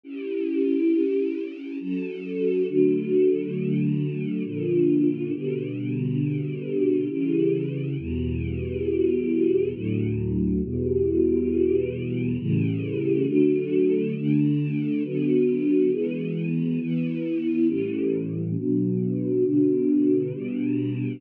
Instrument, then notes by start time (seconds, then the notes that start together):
choir aahs
0.04 C#4 E4 G4
1.80 F#3 C#4 A4
2.68 D3 F#3 A3
4.45 A#2 D3 F3
5.33 B2 D3 G3
7.10 C#3 E3 G3
7.98 E2 B2 G3
9.74 D2 A2 F#3
10.63 E2 B2 G3
12.39 A2 C#3 E3 G3
13.27 D3 F#3 A3
14.16 D3 A3 D4
15.04 D3 F#3 B3
15.92 E3 G#3 B3
16.80 E3 B3 E4
17.68 A2 E3 G3 C#4
18.57 B2 F#3 D4
19.45 B2 D3 D4
20.33 B2 G3 D4